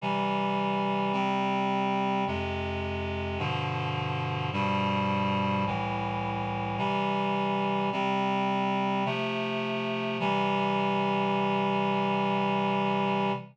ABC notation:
X:1
M:3/4
L:1/8
Q:1/4=53
K:C
V:1 name="Clarinet"
[C,E,G,]2 [C,G,C]2 [F,,C,_A,]2 | [G,,B,,D,F,]2 [G,,B,,F,G,]2 [C,,A,,E,]2 | [C,E,G,]2 [C,G,C]2 [C,F,A,]2 | [C,E,G,]6 |]